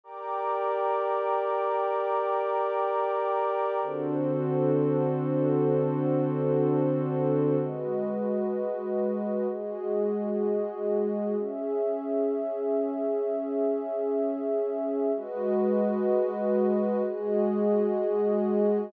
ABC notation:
X:1
M:4/4
L:1/8
Q:1/4=127
K:Gm
V:1 name="Pad 2 (warm)"
[GBd]8- | [GBd]8 | [D,C^FA]8- | [D,C^FA]8 |
[K:G#m] z8 | z8 | z8 | z8 |
z8 | z8 |]
V:2 name="Pad 2 (warm)"
[gbd']8- | [gbd']8 | [D^FAc]8- | [D^FAc]8 |
[K:G#m] [G,FBd]8 | [G,FGd]8 | [CGe]8- | [CGe]8 |
[G,FBd]8 | [G,FGd]8 |]